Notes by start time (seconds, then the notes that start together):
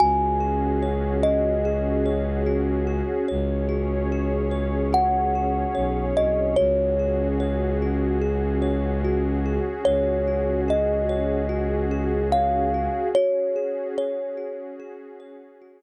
0.00 C#2 C#4 F#4 G#4 G#5
0.40 G#4
0.83 C#5
1.23 F#4 D#5
1.65 G#4
2.06 C#5
2.46 F#4
2.87 G#4
3.28 C#2 C#4 G#4 C#5
3.69 F#4
4.12 G#4
4.51 C#5
4.93 F#4 F#5
5.35 G#4
5.75 B1 C#5
6.17 C2 F#4 D#5
6.56 C#2 C#4 F#4 G#4 C#5
6.99 G#4
7.40 C#5
7.82 F#4
8.21 G#4
8.62 C#5
9.04 F#4
9.46 G#4
9.85 C#2 C#5
10.28 F#4
10.68 G#4 D#5
11.09 C#5
11.49 F#4
11.91 G#4
12.32 C#5 F5
12.74 F#4
13.15 C#4 F#4 G#4 C#5
13.56 G#4
13.98 C#5
14.37 F#4
14.80 G#4
15.20 C#5
15.62 F#4